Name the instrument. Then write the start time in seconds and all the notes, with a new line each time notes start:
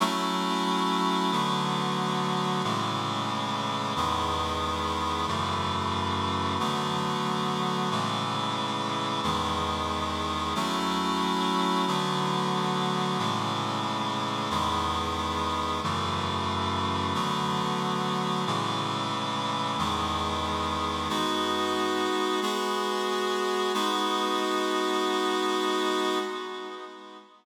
clarinet
0.00 F#3 A3 C#4 E4
1.31 D3 F#3 A3 B3
2.63 A2 C#3 E3 G#3
3.96 E2 D#3 G#3 B3
5.27 F#2 C#3 E3 A3
6.59 D3 F#3 A3 B3
7.91 A2 C#3 E3 G#3
9.23 E2 D#3 G#3 B3
10.55 F#3 A3 C#4 E4
11.87 D3 F#3 A3 B3
13.18 A2 C#3 E3 G#3
14.50 E2 D#3 G#3 B3
15.83 F#2 C#3 E3 A3
17.14 D3 F#3 A3 B3
18.46 A2 C#3 E3 G#3
19.78 E2 D#3 G#3 B3
21.09 G#3 B3 D#4 F#4
22.41 G#3 B3 F#4 G#4
23.74 G#3 B3 D#4 F#4